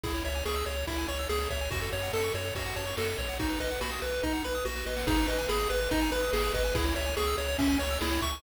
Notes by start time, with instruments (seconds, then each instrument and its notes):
0.03 synth bass 1 C#2, lead 1 (square) E4 G#4, kick, ride
0.14 lead 1 (square) C#5
0.24 synth bass 1 C#2, lead 1 (square) C#5 E5, ride
0.35 lead 1 (square) G#5
0.45 synth bass 1 C#2, lead 1 (square) G#4 C#6, snare
0.56 lead 1 (square) E6
0.66 synth bass 1 C#2, lead 1 (square) G#4 C#5, ride
0.77 lead 1 (square) C#5
0.87 synth bass 1 C#2, lead 1 (square) E4 E5, kick, ride
0.98 lead 1 (square) G#5
1.08 synth bass 1 C#2, lead 1 (square) C#5 C#6, ride
1.19 lead 1 (square) E6
1.29 synth bass 1 C#2, lead 1 (square) G#4, snare
1.40 lead 1 (square) C#5
1.50 synth bass 1 C#2, lead 1 (square) C#5 E5, kick, ride
1.61 lead 1 (square) G#5
1.71 synth bass 1 F#2, lead 1 (square) F#4, kick, ride
1.82 lead 1 (square) A4
1.92 synth bass 1 F#2, lead 1 (square) C#5, ride
2.03 lead 1 (square) F#5
2.13 synth bass 1 F#2, lead 1 (square) A4 A5, snare
2.24 lead 1 (square) C#6
2.34 synth bass 1 F#2, lead 1 (square) F#4 C#5, ride
2.45 lead 1 (square) A4
2.55 synth bass 1 F#2, lead 1 (square) F#4 C#5, kick, ride
2.66 lead 1 (square) F#5
2.76 synth bass 1 F#2, lead 1 (square) C#5 A5, ride
2.87 lead 1 (square) C#6
2.97 synth bass 1 F#2, lead 1 (square) F#4 A4, snare
3.08 lead 1 (square) A4
3.18 synth bass 1 B1, lead 1 (square) C#5, kick, ride
3.29 lead 1 (square) F#5
3.39 lead 1 (square) D#4 F#4, kick, ride
3.50 lead 1 (square) B4
3.60 synth bass 1 B1, lead 1 (square) B4 D#5, ride
3.71 lead 1 (square) F#5
3.81 synth bass 1 B1, lead 1 (square) F#4 B5, snare
3.92 lead 1 (square) D#6
4.02 synth bass 1 B1, lead 1 (square) F#4 B4, ride
4.13 lead 1 (square) B4
4.23 synth bass 1 B1, lead 1 (square) D#4 D#5, kick, snare
4.33 lead 1 (square) F#5
4.44 synth bass 1 B1, lead 1 (square) B4 B5, snare
4.55 lead 1 (square) D#6
4.65 synth bass 1 A#1, lead 1 (square) F#4, snare
4.76 lead 1 (square) B4, snare
4.86 synth bass 1 A1, lead 1 (square) B4 D#5, snare
4.96 lead 1 (square) F#5, snare
5.07 synth bass 1 G#1, lead 1 (square) D#4 G#4, kick, crash
5.17 lead 1 (square) B4
5.28 synth bass 1 G#1, lead 1 (square) B4 D#5, ride
5.39 lead 1 (square) G#5
5.49 synth bass 1 G#1, lead 1 (square) G#4 B5, snare
5.60 lead 1 (square) D#6
5.70 synth bass 1 G#1, lead 1 (square) G#4 B4, ride
5.81 lead 1 (square) B4
5.91 synth bass 1 G#1, lead 1 (square) D#4 D#5, kick, ride
6.01 lead 1 (square) G#5
6.12 synth bass 1 G#1, lead 1 (square) B4 B5, ride
6.23 lead 1 (square) D#6
6.33 synth bass 1 G#1, lead 1 (square) G#4, snare
6.44 lead 1 (square) B4
6.54 synth bass 1 G#1, lead 1 (square) B4 D#5, kick, ride
6.65 lead 1 (square) G#5
6.75 synth bass 1 C#2, lead 1 (square) E4 G#4, kick, ride
6.85 lead 1 (square) C#5
6.96 synth bass 1 C#2, lead 1 (square) C#5 E5, ride
7.06 lead 1 (square) G#5
7.17 synth bass 1 C#2, lead 1 (square) G#4 C#6, snare
7.27 lead 1 (square) E6
7.38 synth bass 1 C#2, lead 1 (square) G#4 C#5, ride
7.48 lead 1 (square) C#5
7.58 synth bass 1 C#2, lead 1 (square) C#4 E5, kick, ride
7.69 lead 1 (square) G#5
7.79 synth bass 1 C#2, lead 1 (square) C#5 C#6, ride
7.90 lead 1 (square) E6
8.01 synth bass 1 C#2, lead 1 (square) E4 G#4, snare
8.11 lead 1 (square) C#5
8.22 synth bass 1 C#2, lead 1 (square) E5 C#6, kick, ride
8.32 lead 1 (square) G#5